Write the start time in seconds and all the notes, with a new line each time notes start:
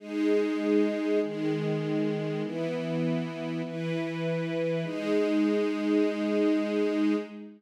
0.00 G#3 D#4 G#4
1.22 D#3 G#3 G#4
2.42 E3 B3 E4
3.65 E3 E4 B4
4.84 G#3 D#4 G#4